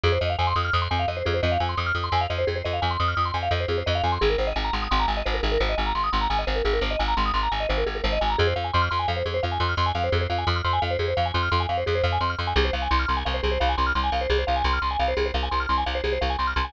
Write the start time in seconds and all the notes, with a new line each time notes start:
0.04 F2 G#4
0.12 C5
0.21 F2 D#5
0.30 F5
0.39 F2 G#5
0.47 C6
0.56 F2 D#6
0.65 F6
0.73 F2 D#6
0.82 C6
0.91 F2 G#5
0.99 F5
1.08 F2 D#5
1.17 C5
1.26 F2 G#4
1.34 C5
1.43 F2 D#5
1.52 F5
1.60 F2 G#5
1.69 C6
1.77 F2 D#6
1.86 F6
1.95 F2 D#6
2.04 C6
2.12 F2 G#5
2.21 F5
2.30 F2 D#5
2.38 C5
2.47 F2 G#4
2.56 C5
2.64 F2 D#5
2.73 F5
2.82 F2 G#5
2.91 C6
3.00 F2 D#6
3.08 F6
3.17 F2 D#6
3.25 C6
3.34 F2 G#5
3.43 F5
3.51 F2 D#5
3.60 C5
3.68 F2 G#4
3.78 C5
3.86 F2 D#5
3.95 F5
4.03 F2 G#5
4.12 C6
4.21 G#1 G#4
4.30 A#4
4.38 G#1 C5
4.47 D#5
4.56 G#1 G#5
4.64 A#5
4.73 G#1 C6
4.82 D#6
4.91 G#1 C6
5.00 A#5
5.08 G#1 G#5
5.17 D#5
5.26 G#1 C5
5.34 A#4
5.43 G#1 G#4
5.52 A#4
5.60 G#1 C5
5.69 D#5
5.78 G#1 G#5
5.86 A#5
5.95 G#1 C6
6.04 D#6
6.13 G#1 C6
6.21 A#5
6.30 G#1 G#5
6.39 D#5
6.47 G#1 C5
6.56 A#4
6.65 G#1 G#4
6.73 A#4
6.81 G#1 C5
6.91 D#5
6.99 G#1 G#5
7.08 A#5
7.17 G#1 C6
7.26 D#6
7.34 G#1 C6
7.43 A#5
7.52 G#1 G#5
7.60 D#5
7.69 G#1 C5
7.78 A#4
7.86 G#1 G#4
7.95 A#4
8.04 G#1 C5
8.13 D#5
8.21 G#1 G#5
8.30 A#5
8.38 F2 G#4
8.47 C5
8.56 F2 F5
8.64 G#5
8.74 F2 C6
8.82 F6
8.91 F2 C6
8.99 G#5
9.08 F2 F5
9.17 C5
9.26 F2 G#4
9.34 C5
9.43 F2 F5
9.52 G#5
9.60 F2 C6
9.69 F6
9.77 F2 C6
9.86 G#5
9.95 F2 F5
10.04 C5
10.12 F2 G#4
10.21 C5
10.30 F2 F5
10.38 G#5
10.47 F2 C6
10.56 F6
10.64 F2 C6
10.73 G#5
10.82 F2 F5
10.91 C5
10.99 F2 G#4
11.08 C5
11.17 F2 F5
11.26 G#5
11.34 F2 C6
11.43 F6
11.52 F2 C6
11.60 G#5
11.69 F2 F5
11.78 C5
11.86 F2 G#4
11.95 C5
12.04 F2 F5
12.12 G#5
12.21 F2 C6
12.30 F6
12.39 F2 C6
12.47 G#5
12.56 C2 G#4
12.65 C5
12.73 C2 F5
12.82 G#5
12.91 C2 C6
12.99 F6
13.08 C2 C6
13.17 G#5
13.25 C2 F5
13.34 C5
13.43 C2 G#4
13.52 C5
13.60 C2 F5
13.69 G#5
13.78 C2 C6
13.87 F6
13.95 C2 C6
14.04 G#5
14.12 C2 F5
14.21 C5
14.30 C2 G#4
14.38 C5
14.47 C2 F5
14.56 G#5
14.64 C2 C6
14.73 F6
14.82 C2 C6
14.91 G#5
14.99 C2 F5
15.08 C5
15.17 C2 G#4
15.26 C5
15.34 C2 F5
15.43 G#5
15.51 C2 C6
15.60 F6
15.69 C2 C6
15.78 G#5
15.86 C2 F5
15.95 C5
16.04 C2 G#4
16.13 C5
16.21 C2 F5
16.30 G#5
16.39 C2 C6
16.47 F6
16.56 C2 C6
16.65 G#5